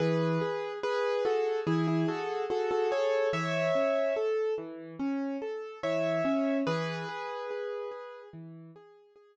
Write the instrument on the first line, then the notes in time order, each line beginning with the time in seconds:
acoustic grand piano
0.00 E3 G#4 B4
0.41 G#4
0.83 G#4 B4
1.25 F#4 G#4 A4
1.67 E3 E4 G#4
1.87 E4 G#4
2.08 F#4 G#4 A4
2.50 F#4 G#4 A4
2.71 F#4 A4
2.91 G#4 A4 C#5
3.33 E3 C#5 E5
3.75 C#4
4.16 A4
4.58 E3
4.99 C#4
5.42 A4
5.83 E3 C#5 E5
6.25 C#4
6.67 E3 G#4 B4
7.09 G#4
7.51 G#4
7.91 G#4
8.33 E3
8.76 G#4
9.16 G#4